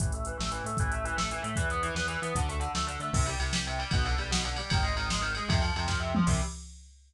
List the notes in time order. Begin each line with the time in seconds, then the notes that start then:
0.00 A1 E3, kick, closed hi-hat
0.12 A3, closed hi-hat
0.25 E3, closed hi-hat
0.38 A1 A3, snare
0.52 E3, closed hi-hat
0.64 A2 A3, closed hi-hat
0.77 A1 E3, kick, closed hi-hat
0.92 A3, closed hi-hat
1.05 E3, closed hi-hat
1.17 A1 A3, snare
1.31 E3, closed hi-hat
1.42 A2 A3, closed hi-hat
1.56 E2 E3, kick, closed hi-hat
1.70 B3, closed hi-hat
1.83 E3, closed hi-hat
1.95 E2 B3, snare
2.08 E3, closed hi-hat
2.22 E3 B3, closed hi-hat
2.35 D2 D3, kick, closed hi-hat
2.49 A3, closed hi-hat
2.60 D3, closed hi-hat
2.75 D2 A3, snare
2.87 D3, closed hi-hat
2.99 D3 A3, closed hi-hat
3.13 C2 C3, kick, crash
3.26 G3, ride
3.40 C2 C3, ride
3.53 G3, snare
3.67 C3, ride
3.79 G3, ride
3.91 B1 B2, kick, ride
4.05 D3, ride
4.18 B1 G3, ride
4.31 B2, snare
4.45 D3, ride
4.56 G3, ride
4.70 G#1 D#3, kick, ride
4.83 G#3, ride
4.95 G#1 D#3, ride
5.10 G#3, snare
5.21 D#3, ride
5.35 G#3, ride
5.49 F2 C3, kick, ride
5.61 F3, ride
5.76 F2 C3, ride
5.88 F3, kick, snare
6.00 C3
6.15 F3, mid tom
6.27 C2 C3 G3, kick, crash